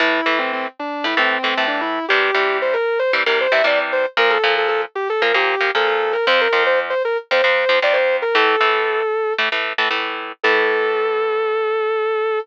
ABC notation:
X:1
M:4/4
L:1/16
Q:1/4=115
K:Aphr
V:1 name="Distortion Guitar"
E3 C C z D2 E C2 C2 D E2 | G4 c B2 c z B c e d z c z | B A2 A A z G A B G3 A A2 B | c B2 c z c B z c c3 d c2 B |
A8 z8 | A16 |]
V:2 name="Overdriven Guitar"
[A,,E,A,]2 [A,,E,A,]6 [A,,E,A,] [A,,E,A,]2 [A,,E,A,] [A,,E,A,]4 | [C,E,G,]2 [C,E,G,]6 [C,E,G,] [C,E,G,]2 [C,E,G,] [C,E,G,]4 | [B,,F,B,]2 [B,,F,B,]6 [B,,F,B,] [B,,F,B,]2 [B,,F,B,] [B,,F,B,]4 | [F,,F,C]2 [F,,F,C]6 [F,,F,C] [F,,F,C]2 [F,,F,C] [F,,F,C]4 |
[A,,E,A,]2 [A,,E,A,]6 [A,,E,A,] [A,,E,A,]2 [A,,E,A,] [A,,E,A,]4 | [A,,E,A,]16 |]